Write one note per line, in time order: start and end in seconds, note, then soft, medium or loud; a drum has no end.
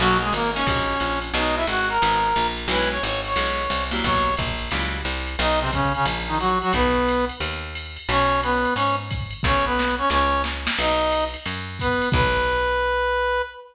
0.00 0.31 B1 loud
0.00 0.18 F#3 medium
0.00 0.28 A#3 medium
0.00 0.28 C#4 medium
0.00 0.28 D#4 medium
0.00 0.18 F#4 medium
0.00 0.28 F#4 medium
0.00 crash loud
0.00 ride medium
0.21 0.33 G#3 medium
0.21 0.33 G#4 medium
0.33 0.64 G#1 medium
0.33 0.51 A#3 medium
0.33 0.51 A#4 medium
0.33 hi-hat pedal loud
0.33 ride medium
0.54 0.65 A#3 medium
0.54 1.19 C#4 medium
0.54 0.65 C#4 medium
0.54 0.65 D#4 medium
0.54 0.65 F#4 medium
0.54 1.19 C#5 medium
0.54 ride medium
0.67 0.98 A#1 medium
0.67 0.93 A#3 medium
0.67 0.93 C#4 medium
0.67 0.93 D#4 medium
0.67 0.93 F#4 medium
0.67 kick medium
0.67 ride loud
1.00 1.32 A#1 medium
1.00 hi-hat pedal medium
1.00 ride loud
1.22 ride medium
1.34 1.65 B1 loud
1.34 1.61 G#3 medium
1.34 1.61 B3 medium
1.34 1.61 D#4 medium
1.34 1.55 D#4 medium
1.34 1.61 F#4 medium
1.34 1.55 D#5 medium
1.34 ride loud
1.56 1.66 E4 medium
1.56 1.66 E5 medium
1.67 1.99 G#1 medium
1.67 1.88 F#4 medium
1.67 1.88 F#5 medium
1.67 hi-hat pedal medium
1.67 ride medium
1.89 2.47 A#4 medium
1.89 2.47 A#5 medium
1.89 ride medium
2.02 2.34 G#1 medium
2.02 2.28 G#3 medium
2.02 2.28 B3 medium
2.02 2.28 D#4 medium
2.02 2.28 F#4 medium
2.02 ride loud
2.36 2.67 A#1 loud
2.36 hi-hat pedal medium
2.36 ride loud
2.57 ride medium
2.68 2.99 B1 loud
2.68 2.97 G#3 medium
2.68 2.97 B3 medium
2.68 2.97 C#4 medium
2.68 2.97 E4 medium
2.68 2.89 B4 medium
2.68 2.89 B5 medium
2.68 ride loud
2.91 3.03 C#5 medium
2.91 3.03 C#6 medium
3.03 3.34 G#1 medium
3.03 3.21 C#5 medium
3.03 3.21 C#6 medium
3.03 hi-hat pedal medium
3.03 ride loud
3.25 3.84 C#5 medium
3.25 3.84 C#6 medium
3.25 ride medium
3.36 3.67 B1 medium
3.36 3.62 G#3 medium
3.36 3.62 B3 medium
3.36 3.62 C#4 medium
3.36 3.62 E4 medium
3.36 ride loud
3.70 4.01 C2 medium
3.70 hi-hat pedal loud
3.70 ride loud
3.91 4.30 F#3 medium
3.91 4.30 G3 medium
3.91 4.30 A#3 medium
3.91 4.30 E4 medium
3.91 ride medium
4.04 4.36 B1 medium
4.04 4.35 C#5 medium
4.04 4.35 C#6 medium
4.04 kick medium
4.04 ride loud
4.37 4.70 A#1 medium
4.37 kick medium
4.37 hi-hat pedal loud
4.37 ride loud
4.59 ride medium
4.71 5.03 C#2 medium
4.71 4.98 F#3 medium
4.71 4.98 G3 medium
4.71 4.98 A#3 medium
4.71 4.98 E4 medium
4.71 ride loud
5.05 5.36 C2 medium
5.05 hi-hat pedal medium
5.05 ride medium
5.27 ride medium
5.39 5.96 B1 loud
5.39 5.60 D#4 medium
5.39 5.60 D#5 medium
5.39 ride loud
5.60 5.71 C3 medium
5.60 5.71 C4 medium
5.73 5.93 C#3 medium
5.73 5.93 C#4 medium
5.73 kick medium
5.73 hi-hat pedal medium
5.73 ride loud
5.94 6.06 C#3 medium
5.94 6.06 C#4 medium
5.94 ride medium
6.06 6.63 A#1 medium
6.06 ride loud
6.28 6.38 D#3 medium
6.28 6.38 D#4 medium
6.39 6.59 F#3 medium
6.39 6.59 F#4 medium
6.39 hi-hat pedal medium
6.39 ride medium
6.62 6.73 F#3 medium
6.62 6.73 F#4 medium
6.62 ride medium
6.73 7.31 B1 loud
6.73 7.25 B3 medium
6.73 7.25 B4 medium
6.73 kick medium
6.73 ride loud
7.08 hi-hat pedal medium
7.08 ride loud
7.29 ride medium
7.40 7.98 D#2 medium
7.40 ride loud
7.75 hi-hat pedal medium
7.75 ride loud
7.97 ride medium
8.09 8.66 B1 loud
8.09 8.41 C#4 medium
8.09 8.41 C#5 medium
8.09 ride loud
8.43 8.74 B3 medium
8.43 8.74 B4 medium
8.43 hi-hat pedal medium
8.43 ride loud
8.65 ride medium
8.75 9.33 G#2 medium
8.75 8.96 C#4 medium
8.75 8.96 C#5 medium
8.75 ride loud
9.11 kick medium
9.11 hi-hat pedal loud
9.11 ride loud
9.31 ride medium
9.43 10.02 B1 loud
9.43 9.65 C#4 medium
9.43 9.65 C#5 medium
9.43 kick medium
9.43 snare medium
9.65 9.95 B3 medium
9.65 9.95 B4 medium
9.79 snare loud
9.98 10.09 C#4 medium
9.98 10.09 C#5 medium
10.10 10.68 C#2 medium
10.10 10.42 C#4 medium
10.10 10.42 C#5 medium
10.10 snare loud
10.44 snare loud
10.67 snare loud
10.77 11.36 B1 loud
10.77 11.25 D#4 medium
10.77 11.25 D#5 medium
10.77 crash loud
10.77 ride loud
11.11 hi-hat pedal medium
11.11 ride loud
11.34 ride medium
11.46 12.04 F#2 medium
11.46 ride loud
11.79 12.09 B3 medium
11.79 12.09 B4 medium
11.79 kick medium
11.79 hi-hat pedal medium
11.79 ride medium
12.02 ride medium
12.12 13.42 B1 loud
12.12 13.42 B4 loud
12.12 kick loud
12.12 crash loud